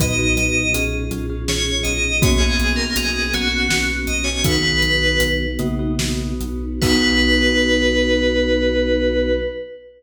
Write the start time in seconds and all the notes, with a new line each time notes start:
0.00 B1 A#2 F#3 B3 D#4 F#4 B4 D#5, kick, closed hi-hat
0.19 D#4 F#4 B4
0.35 B1 D#5, closed hi-hat
0.74 B1 C#4 F4 G#4, closed hi-hat
1.11 B1 C#4 F4 G#4, closed hi-hat
1.30 C#4 F4 G#4
1.47 B1 C#4 F4 G#4 C#5, snare
1.83 B1 D#5, closed hi-hat
2.22 B1 A#3 B3 C#4 F#4 C#5, kick, closed hi-hat
2.38 B3 C#4 F#4 G#4
2.59 B1, closed hi-hat
2.76 A#4
2.96 B1 G#4, closed hi-hat
3.33 B1 B3 C#4 F#4, closed hi-hat
3.52 B3 C#4 F#4
3.69 B1 B3 C#4 F#4, snare
4.07 B1 D#5, closed hi-hat
4.24 C#5
4.44 B1 D#3 B3 D#4 F#4 B4, kick, closed hi-hat
4.63 B3 D#4 F#4
4.82 B1, closed hi-hat
5.20 B1, closed hi-hat
5.59 B1 C#3 A#3 B3 D#4 F#4, closed hi-hat
5.79 B3 D#4 F#4
5.99 B1 B3 D#4 F#4, snare
6.40 B1, closed hi-hat
6.82 B1 B3 D#4 F#4 B4, kick, crash